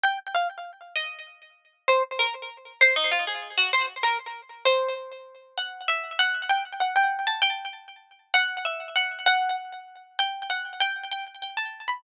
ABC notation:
X:1
M:6/8
L:1/8
Q:3/8=130
K:Db
V:1 name="Pizzicato Strings"
=g z f z3 | e2 z4 | c z B z3 | c E F A2 G |
c z B z3 | c2 z4 | [K:D] f2 e2 f2 | g z f g2 a |
g2 z4 | f2 e2 f2 | f2 z4 | g2 f2 g2 |
g z g a2 b |]